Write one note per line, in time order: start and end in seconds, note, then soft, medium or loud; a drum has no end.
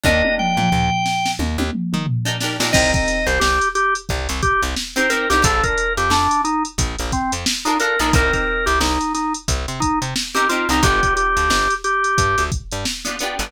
0.04 0.23 D#2 loud
0.04 0.60 D4 loud
0.04 0.60 D#4 loud
0.04 0.60 G4 loud
0.04 0.60 A#4 loud
0.04 0.35 D#5 loud
0.04 kick medium
0.04 high tom medium
0.24 high tom medium
0.38 1.31 G5 medium
0.38 mid tom medium
0.57 0.70 A#2 medium
0.57 mid tom medium
0.72 0.90 D#2 medium
0.72 floor tom medium
1.06 snare medium
1.26 snare medium
1.39 1.57 D#2 medium
1.39 high tom medium
1.58 1.71 D#2 loud
1.58 high tom medium
1.73 mid tom medium
1.93 2.06 D#3 medium
1.93 mid tom medium
2.07 floor tom medium
2.25 2.36 D4 medium
2.25 2.36 D#4 loud
2.25 2.36 G4 medium
2.25 2.36 A#4 loud
2.40 2.57 D4 medium
2.40 2.57 D#4 medium
2.40 2.57 G4 medium
2.40 2.57 A#4 loud
2.40 snare medium
2.60 2.72 A#2 medium
2.60 2.71 D4 loud
2.60 2.71 D#4 loud
2.60 2.71 G4 loud
2.60 2.71 A#4 loud
2.60 snare medium
2.73 2.93 C2 loud
2.73 3.29 C4 loud
2.73 3.29 D#4 loud
2.73 3.29 G4 loud
2.73 3.29 A#4 loud
2.73 2.92 D#5 loud
2.73 kick medium
2.73 crash medium
2.94 3.26 D#5 medium
2.94 kick medium
2.94 closed hi-hat medium
3.08 snare soft
3.08 closed hi-hat medium
3.27 3.39 C2 loud
3.27 3.40 C5 medium
3.27 closed hi-hat medium
3.40 3.59 C2 medium
3.40 3.69 G4 loud
3.40 snare medium
3.62 closed hi-hat medium
3.75 3.94 G4 loud
3.75 closed hi-hat medium
3.95 closed hi-hat medium
4.09 4.28 C2 loud
4.09 kick medium
4.09 closed hi-hat soft
4.29 4.42 C2 loud
4.29 closed hi-hat medium
4.43 4.62 G4 loud
4.43 kick medium
4.43 closed hi-hat medium
4.62 4.75 C2 medium
4.62 closed hi-hat medium
4.77 snare medium
4.96 5.07 C4 loud
4.96 5.07 D#4 medium
4.96 5.07 G4 loud
4.96 5.07 A#4 loud
4.96 5.10 C5 medium
4.96 snare soft
4.96 closed hi-hat medium
5.10 5.26 C4 loud
5.10 5.26 D#4 loud
5.10 5.26 G4 loud
5.10 5.29 A#4 medium
5.10 5.26 A#4 loud
5.10 closed hi-hat medium
5.30 5.43 C2 medium
5.30 5.42 C4 medium
5.30 5.42 D#4 loud
5.30 5.43 G4 loud
5.30 5.42 G4 loud
5.30 5.42 A#4 medium
5.30 snare medium
5.30 closed hi-hat medium
5.42 5.62 A#1 loud
5.42 5.99 D4 loud
5.42 5.99 F4 loud
5.42 5.99 A4 loud
5.42 5.63 A4 loud
5.42 5.99 A#4 loud
5.42 kick medium
5.42 closed hi-hat loud
5.64 5.93 A#4 loud
5.64 kick medium
5.64 closed hi-hat medium
5.78 closed hi-hat medium
5.97 6.10 F2 medium
5.97 6.11 G4 medium
5.97 closed hi-hat medium
6.10 6.28 F2 medium
6.10 6.42 D4 loud
6.10 snare medium
6.31 closed hi-hat medium
6.44 6.63 D#4 medium
6.44 closed hi-hat medium
6.65 closed hi-hat medium
6.78 6.96 A#1 medium
6.78 kick medium
6.78 closed hi-hat medium
6.99 7.12 A#1 medium
6.99 closed hi-hat medium
7.12 7.32 C4 medium
7.12 kick medium
7.12 snare soft
7.12 closed hi-hat medium
7.32 7.45 F2 medium
7.32 closed hi-hat medium
7.46 snare loud
7.65 7.76 D4 medium
7.65 7.78 D#4 loud
7.65 7.76 F4 loud
7.65 7.76 A4 medium
7.65 7.76 A#4 medium
7.65 closed hi-hat medium
7.80 7.96 D4 medium
7.80 7.96 F4 medium
7.80 7.96 A4 medium
7.80 7.99 A#4 loud
7.80 7.96 A#4 medium
7.80 closed hi-hat medium
7.99 8.12 A#1 medium
7.99 8.10 D4 loud
7.99 8.14 D#4 medium
7.99 8.10 F4 medium
7.99 8.10 A4 medium
7.99 8.10 A#4 loud
7.99 snare soft
7.99 closed hi-hat medium
8.13 8.31 C2 loud
8.13 8.71 C4 loud
8.13 8.71 D#4 loud
8.13 8.71 G4 medium
8.13 8.33 A#4 loud
8.13 8.71 A#4 loud
8.13 kick loud
8.13 closed hi-hat medium
8.33 8.65 A#4 medium
8.33 kick medium
8.33 snare soft
8.33 closed hi-hat medium
8.66 8.79 C2 medium
8.66 8.79 G4 medium
8.66 closed hi-hat medium
8.80 8.98 C2 medium
8.80 9.13 D#4 medium
8.80 snare medium
9.01 closed hi-hat medium
9.14 9.33 D#4 medium
9.14 snare soft
9.14 closed hi-hat medium
9.34 closed hi-hat medium
9.48 9.66 C2 loud
9.48 kick medium
9.48 closed hi-hat medium
9.68 9.81 C3 medium
9.68 closed hi-hat medium
9.80 9.99 D#4 loud
9.80 kick medium
9.80 closed hi-hat medium
10.02 10.14 C3 medium
10.02 closed hi-hat medium
10.16 snare medium
10.35 10.46 C4 loud
10.35 10.46 D#4 medium
10.35 10.48 G4 medium
10.35 10.46 G4 loud
10.35 10.46 A#4 medium
10.35 closed hi-hat medium
10.49 10.66 C4 loud
10.49 10.66 D#4 medium
10.49 10.68 F4 medium
10.49 10.66 G4 medium
10.49 10.66 A#4 medium
10.49 closed hi-hat medium
10.69 10.81 C2 loud
10.69 10.81 C4 medium
10.69 10.83 D#4 loud
10.69 10.81 D#4 medium
10.69 10.81 G4 medium
10.69 snare soft
10.69 closed hi-hat medium
10.73 10.81 A#4 medium
10.83 11.01 G1 loud
10.83 11.39 B3 loud
10.83 11.39 D4 loud
10.83 11.39 F4 medium
10.83 11.14 G4 loud
10.83 11.39 G4 loud
10.83 kick medium
10.83 closed hi-hat medium
11.03 kick medium
11.03 closed hi-hat medium
11.16 11.74 G4 medium
11.16 closed hi-hat medium
11.37 11.49 D2 medium
11.37 closed hi-hat medium
11.50 11.68 G1 medium
11.50 snare medium
11.71 closed hi-hat medium
11.84 12.44 G4 medium
11.84 closed hi-hat medium
12.04 closed hi-hat medium
12.18 12.36 G2 medium
12.18 kick medium
12.18 closed hi-hat medium
12.38 12.50 D2 medium
12.38 snare soft
12.38 closed hi-hat medium
12.52 kick medium
12.52 closed hi-hat medium
12.71 12.85 G2 medium
12.71 closed hi-hat medium
12.85 snare medium
13.05 13.16 B3 medium
13.05 13.16 D4 medium
13.05 13.16 F4 medium
13.05 13.16 G4 medium
13.05 closed hi-hat medium
13.19 13.36 B3 medium
13.19 13.36 D4 loud
13.19 13.36 F4 medium
13.19 closed hi-hat medium
13.23 13.36 G4 medium
13.39 13.52 G1 loud
13.39 13.51 B3 loud
13.39 13.51 D4 medium
13.39 13.51 F4 medium
13.39 13.51 G4 medium
13.39 snare medium
13.39 closed hi-hat medium